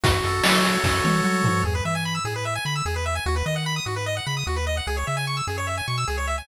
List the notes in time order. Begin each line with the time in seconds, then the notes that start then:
0.04 F#2 F#4, kick, closed hi-hat
0.23 F#2 A4, closed hi-hat
0.44 F#3 C#5, snare
0.64 F#4, closed hi-hat
0.84 F#2 A4, kick, snare
1.04 E3 C#5, high tom
1.24 F#3 F#4
1.44 F3 A4, floor tom
1.64 E2 G#4
1.75 B4
1.85 E3 E5
1.95 G#5
2.05 B5
2.15 E6
2.25 A2 G#4
2.36 B4
2.45 E5
2.55 G#5
2.65 D3 B5
2.76 E6
2.85 E2 G#4
2.96 B4
3.06 E5
3.15 G#5
3.26 D#2 F#4
3.36 B4
3.46 D#3 D#5
3.56 F#5
3.66 B5
3.76 D#6
3.86 G#2 F#4
3.96 B4
4.06 D#5
4.17 F#5
4.27 C#3 B5
4.37 D#6
4.47 D#2 F#4
4.56 B4
4.67 D#5
4.77 F#5
4.87 C#2 G#4
4.97 C#5
5.07 C#3 E5
5.17 G#5
5.27 C#6
5.37 E6
5.47 F#2 G#4
5.58 C#5
5.67 E5
5.78 G#5
5.88 B2 C#6
5.98 E6
6.08 C#2 G#4
6.18 C#5
6.27 E5
6.38 G#5